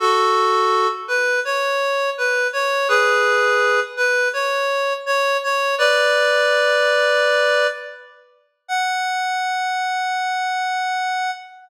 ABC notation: X:1
M:4/4
L:1/8
Q:1/4=83
K:F#m
V:1 name="Clarinet"
[FA]3 B c2 B c | [GB]3 B c2 c c | [Bd]6 z2 | f8 |]